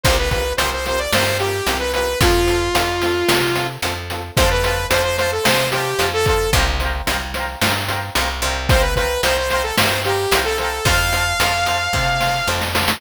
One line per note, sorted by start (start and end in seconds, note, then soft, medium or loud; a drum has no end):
0.03 0.53 C2 loud
0.03 0.16 C4 medium
0.03 0.16 F4 medium
0.03 0.16 C5 medium
0.03 kick loud
0.03 closed hi-hat loud
0.09 0.16 G4 medium
0.09 0.16 A#4 medium
0.19 0.30 B4 medium
0.30 0.42 C4 medium
0.30 0.42 F4 medium
0.30 0.53 B4 medium
0.30 kick medium
0.30 closed hi-hat medium
0.34 0.42 G4 medium
0.34 0.42 A#4 medium
0.57 1.07 C2 medium
0.57 0.70 C4 medium
0.57 0.70 F4 medium
0.57 0.70 C5 medium
0.57 closed hi-hat loud
0.62 0.70 G4 medium
0.62 0.70 A#4 medium
0.73 0.86 C5 medium
0.84 0.95 C4 medium
0.84 0.95 F4 medium
0.84 0.95 G4 medium
0.84 1.00 C5 medium
0.84 snare medium
0.84 closed hi-hat medium
0.89 0.95 A#4 medium
0.99 1.11 D5 medium
1.12 1.61 G2 medium
1.12 1.24 C4 medium
1.12 1.24 F4 medium
1.12 1.38 C5 medium
1.12 snare loud
1.17 1.24 G4 medium
1.17 1.24 A#4 medium
1.39 1.50 C4 medium
1.39 1.50 F4 medium
1.39 1.78 G4 medium
1.39 1.50 G4 medium
1.39 closed hi-hat medium
1.44 1.50 A#4 medium
1.66 2.15 C2 medium
1.66 1.78 C4 medium
1.66 1.78 F4 medium
1.66 1.78 G4 medium
1.66 closed hi-hat loud
1.72 1.78 A#4 medium
1.79 1.92 B4 medium
1.93 2.05 C4 medium
1.93 2.05 F4 medium
1.93 2.19 B4 medium
1.93 closed hi-hat medium
1.97 2.05 G4 medium
1.97 2.05 A#4 medium
2.20 2.69 F2 loud
2.20 2.31 C4 medium
2.20 2.31 F4 medium
2.20 3.67 F4 medium
2.20 2.31 A4 medium
2.20 kick loud
2.20 closed hi-hat loud
2.46 2.57 C4 medium
2.46 2.57 F4 medium
2.46 2.57 A4 medium
2.46 closed hi-hat medium
2.74 3.23 F2 medium
2.74 2.84 C4 medium
2.74 2.84 F4 medium
2.74 2.84 A4 medium
2.74 closed hi-hat loud
3.01 3.13 C4 medium
3.01 3.13 F4 medium
3.01 3.13 A4 medium
3.01 snare medium
3.01 closed hi-hat medium
3.28 3.77 C3 loud
3.28 3.40 C4 medium
3.28 3.40 F4 medium
3.28 3.40 A4 medium
3.28 snare loud
3.55 3.67 C4 medium
3.55 3.67 F4 medium
3.55 3.67 A4 medium
3.55 closed hi-hat medium
3.82 4.31 F2 medium
3.82 3.93 C4 medium
3.82 3.93 F4 medium
3.82 3.93 A4 medium
3.82 closed hi-hat loud
4.10 4.21 C4 medium
4.10 4.21 F4 medium
4.10 4.21 A4 medium
4.10 closed hi-hat medium
4.36 4.86 F2 loud
4.36 4.49 C5 medium
4.36 4.49 F5 medium
4.36 kick loud
4.36 closed hi-hat loud
4.42 4.49 A5 medium
4.51 4.63 B4 medium
4.64 4.87 B4 medium
4.64 4.74 C5 medium
4.64 4.74 F5 medium
4.64 4.74 A5 medium
4.64 closed hi-hat medium
4.90 5.39 F2 medium
4.90 5.02 C5 medium
4.90 5.02 F5 medium
4.90 closed hi-hat loud
4.95 5.02 A5 medium
5.04 5.17 C5 medium
5.18 5.31 C5 medium
5.18 5.29 C5 medium
5.18 5.29 F5 medium
5.18 5.29 A5 medium
5.18 snare medium
5.18 closed hi-hat medium
5.32 5.45 A4 medium
5.43 5.94 C3 medium
5.43 5.54 C5 medium
5.43 5.69 C5 medium
5.43 5.54 F5 medium
5.43 5.54 A5 medium
5.43 snare loud
5.71 6.07 G4 medium
5.71 5.84 C5 medium
5.71 5.84 F5 medium
5.71 closed hi-hat medium
5.77 5.84 A5 medium
5.98 6.47 F2 medium
5.98 6.09 C5 medium
5.98 6.09 F5 medium
5.98 6.09 A5 medium
5.98 closed hi-hat loud
6.13 6.25 A4 medium
6.26 6.51 A4 medium
6.26 6.38 C5 medium
6.26 6.38 F5 medium
6.26 kick medium
6.26 closed hi-hat medium
6.31 6.38 A5 medium
6.53 7.02 C2 loud
6.53 6.65 C5 medium
6.53 6.65 F5 medium
6.53 kick loud
6.53 closed hi-hat loud
6.57 6.65 G5 medium
6.57 6.65 A#5 medium
6.80 6.91 C5 medium
6.80 6.91 F5 medium
6.80 6.91 G5 medium
6.80 snare soft
6.80 closed hi-hat medium
6.85 6.91 A#5 medium
7.06 7.56 C2 medium
7.06 7.17 C5 medium
7.06 7.17 F5 medium
7.06 7.17 G5 medium
7.06 closed hi-hat loud
7.11 7.17 A#5 medium
7.34 7.46 C5 medium
7.34 7.46 F5 medium
7.34 snare medium
7.34 closed hi-hat medium
7.38 7.46 G5 medium
7.38 7.46 A#5 medium
7.61 8.10 G2 medium
7.61 7.72 C5 medium
7.61 7.72 F5 medium
7.61 7.72 G5 medium
7.61 snare loud
7.66 7.72 A#5 medium
7.88 7.98 C5 medium
7.88 7.98 F5 medium
7.88 7.98 G5 medium
7.88 closed hi-hat medium
7.92 7.98 A#5 medium
8.15 8.41 C2 medium
8.15 8.26 C5 medium
8.15 8.26 F5 medium
8.15 8.26 G5 medium
8.15 closed hi-hat loud
8.21 8.26 A#5 medium
8.42 9.18 C2 loud
8.42 8.53 C5 medium
8.42 8.53 F5 medium
8.42 8.53 G5 medium
8.42 closed hi-hat medium
8.47 8.53 A#5 medium
8.69 8.82 C5 medium
8.69 8.81 C5 medium
8.69 8.81 F5 medium
8.69 kick loud
8.69 closed hi-hat loud
8.74 8.81 G5 medium
8.74 8.81 A#5 medium
8.81 8.94 B4 medium
8.96 9.21 B4 medium
8.96 9.07 C5 medium
8.96 9.07 F5 medium
8.96 9.07 G5 medium
8.96 kick medium
8.96 closed hi-hat medium
9.01 9.07 A#5 medium
9.22 9.72 C2 medium
9.22 9.33 C5 medium
9.22 9.37 C5 medium
9.22 9.33 F5 medium
9.22 9.33 G5 medium
9.22 closed hi-hat loud
9.27 9.33 A#5 medium
9.37 9.49 C5 medium
9.50 9.63 C5 medium
9.50 9.61 C5 medium
9.50 9.61 F5 medium
9.50 9.61 G5 medium
9.50 snare medium
9.50 closed hi-hat medium
9.55 9.61 A#5 medium
9.63 9.76 A4 medium
9.77 10.26 G2 medium
9.77 9.88 C5 medium
9.77 10.00 C5 medium
9.77 9.88 F5 medium
9.77 9.88 G5 medium
9.77 snare loud
9.82 9.88 A#5 medium
10.04 10.40 G4 medium
10.04 10.15 C5 medium
10.04 10.15 F5 medium
10.04 10.15 G5 medium
10.04 closed hi-hat medium
10.09 10.15 A#5 medium
10.31 10.80 C2 medium
10.31 10.43 C5 medium
10.31 10.43 F5 medium
10.31 closed hi-hat loud
10.35 10.43 G5 medium
10.35 10.43 A#5 medium
10.45 10.57 A4 medium
10.58 10.85 A4 medium
10.58 10.69 C5 medium
10.58 10.69 F5 medium
10.58 10.69 G5 medium
10.58 closed hi-hat medium
10.63 10.69 A#5 medium
10.85 11.34 F2 loud
10.85 10.95 C5 medium
10.85 12.48 F5 medium
10.85 10.95 F5 medium
10.85 10.95 A5 medium
10.85 kick loud
10.85 closed hi-hat loud
11.13 11.24 C5 medium
11.13 11.24 F5 medium
11.13 11.24 A5 medium
11.13 closed hi-hat medium
11.40 11.88 F2 medium
11.40 11.51 C5 medium
11.40 11.51 F5 medium
11.40 11.51 A5 medium
11.40 closed hi-hat loud
11.66 11.78 C5 medium
11.66 11.78 F5 medium
11.66 11.78 A5 medium
11.66 snare medium
11.66 closed hi-hat medium
11.93 12.42 C3 medium
11.93 12.05 C5 medium
11.93 12.05 F5 medium
11.93 kick medium
11.93 snare medium
11.97 12.05 A5 medium
12.20 12.31 C5 medium
12.20 12.31 F5 medium
12.20 12.31 A5 medium
12.20 snare medium
12.47 12.96 F2 medium
12.47 12.59 C5 medium
12.47 12.59 F5 medium
12.47 12.59 A5 medium
12.47 snare medium
12.61 snare medium
12.74 12.85 C5 medium
12.74 12.85 F5 medium
12.74 12.85 A5 medium
12.74 snare loud
12.88 snare loud